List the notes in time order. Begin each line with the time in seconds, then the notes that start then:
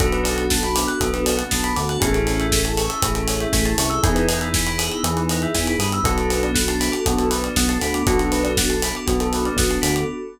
0.00 B1 B3 D4 F#4 A4, kick, closed hi-hat
0.12 B4, closed hi-hat
0.24 D5, open hi-hat
0.36 F#5, closed hi-hat
0.50 A5, kick, snare
0.63 B5, closed hi-hat
0.75 D6, open hi-hat
0.88 F#6, closed hi-hat
1.01 B1 B3 A4, kick, closed hi-hat
1.13 B4, closed hi-hat
1.26 D5, open hi-hat
1.37 F#5, closed hi-hat
1.51 B1 B3 A5, kick, snare
1.64 B5, closed hi-hat
1.76 D2 D3 D6, open hi-hat
1.89 F#6, closed hi-hat
2.00 A1 C#4 E4 G#4 A4, kick, closed hi-hat
2.13 A4, closed hi-hat
2.27 C#5, open hi-hat
2.40 E5, closed hi-hat
2.52 G#5, kick, snare
2.63 A5, closed hi-hat
2.77 C#6, open hi-hat
2.89 E6, closed hi-hat
3.02 A1 A3 G#4, kick, closed hi-hat
3.15 A4, closed hi-hat
3.28 C#5, open hi-hat
3.40 E5, closed hi-hat
3.53 A1 A3 G#5, kick, snare
3.65 A5, closed hi-hat
3.78 C2 C3 C#6, open hi-hat
3.90 E6, closed hi-hat
4.03 E2 B3 D#4 E4 G#4, kick, closed hi-hat
4.15 B4, closed hi-hat
4.28 D#5, open hi-hat
4.41 E5, closed hi-hat
4.54 G#5, kick, snare
4.66 B5, closed hi-hat
4.78 D#6, open hi-hat
4.91 E6, closed hi-hat
5.03 E2 E3 G#4, closed hi-hat
5.17 B4, closed hi-hat
5.29 D#5, open hi-hat
5.42 E5, closed hi-hat
5.54 E2 E3 G#5, kick, snare
5.66 B5, closed hi-hat
5.78 G2 G3 D#6, open hi-hat
5.92 E6, closed hi-hat
6.03 B1 B3 D4 F#4 A4, kick, closed hi-hat
6.18 A4, closed hi-hat
6.30 B4, open hi-hat
6.43 D5, closed hi-hat
6.55 F#5, kick, snare
6.68 A5, closed hi-hat
6.80 B5, open hi-hat
6.92 D6, closed hi-hat
7.06 B1 B3 F#4, kick, closed hi-hat
7.18 A4, closed hi-hat
7.30 B4, open hi-hat
7.44 D5, closed hi-hat
7.56 B1 B3 F#5, kick, snare
7.69 A5, closed hi-hat
7.81 D2 D3 B5, open hi-hat
7.94 D6, closed hi-hat
8.06 B1 B3 D4 F#4 A4, kick, closed hi-hat
8.19 A4, closed hi-hat
8.32 B4, open hi-hat
8.44 D5, closed hi-hat
8.57 F#5, kick, snare
8.70 A5, closed hi-hat
8.82 B5, open hi-hat
8.95 D6, closed hi-hat
9.06 B1 B3 F#4, kick, closed hi-hat
9.20 A4, closed hi-hat
9.33 B4, open hi-hat
9.45 D5, closed hi-hat
9.57 B1 B3 F#5, kick, snare
9.70 A5, closed hi-hat
9.82 D2 D3 B5, open hi-hat
9.96 D6, closed hi-hat